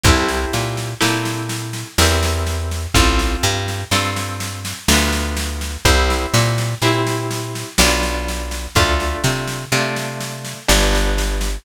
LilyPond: <<
  \new Staff \with { instrumentName = "Orchestral Harp" } { \time 3/4 \key c \major \tempo 4 = 62 <c' e' g' a'>4 <c' e' g' a'>4 <c' e' g' bes'>4 | <c' f' a'>4 <c' f' a'>4 <b d' f'>4 | <c' e' g'>4 <c' e' g'>4 <b d' f'>4 | <a d' f'>4 <a d' f'>4 <g b d'>4 | }
  \new Staff \with { instrumentName = "Electric Bass (finger)" } { \clef bass \time 3/4 \key c \major c,8 bes,8 bes,4 e,4 | a,,8 g,8 g,4 d,4 | c,8 bes,8 bes,4 b,,4 | d,8 c8 c4 g,,4 | }
  \new DrumStaff \with { instrumentName = "Drums" } \drummode { \time 3/4 <bd sn>16 sn16 sn16 sn16 sn16 sn16 sn16 sn16 sn16 sn16 sn16 sn16 | <bd sn>16 sn16 sn16 sn16 sn16 sn16 sn16 sn16 sn16 sn16 sn16 sn16 | <bd sn>16 sn16 sn16 sn16 sn16 sn16 sn16 sn16 sn16 sn16 sn16 sn16 | <bd sn>16 sn16 sn16 sn16 sn16 sn16 sn16 sn16 sn16 sn16 sn16 sn16 | }
>>